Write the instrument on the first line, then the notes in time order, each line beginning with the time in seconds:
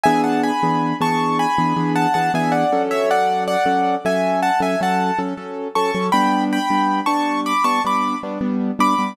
acoustic grand piano
0.03 E3 B3 D4 G#4 E5 G#5
0.24 F#5 A5
0.43 G#5 B5
0.63 E3 B3 D4 G#4
1.01 E3 B3 D4 G#4 A5 C#6
1.39 G#5 B5
1.58 E3 B3 D4 G#4
1.76 E3 B3 D4 G#4
1.95 F#5 A5
2.14 E3 B3 D4 G#4 F#5 A5
2.34 E3 B3 D4 G#4 E5 G#5
2.52 D5 F#5
2.72 F#3 C#4 A4
2.91 C#5 E5
3.11 D5 F#5
3.47 D5 F#5
3.66 F#3 C#4 A4
4.05 F#3 C#4 A4 E5 G#5
4.42 F#5 A5
4.60 F#3 C#4 A4 E5 G#5
4.81 F#3 C#4 A4 F#5 A5
5.19 F#3 C#4 A4
5.37 F#3 C#4 A4
5.75 F#3 C#4 A4 A5 C#6
5.95 F#3 C#4 A4
6.12 G3 B3 D4 G5 B5
6.53 G5 B5
6.70 G3 B3 D4
7.06 G3 B3 D4 A5 C#6
7.46 B5 D6
7.64 G3 B3 D4 A5 C#6
7.84 G3 B3 D4 B5 D6
8.23 G3 B3 D4
8.41 G3 B3 D4
8.79 G3 B3 D4 B5 D6
8.98 G3 B3 D4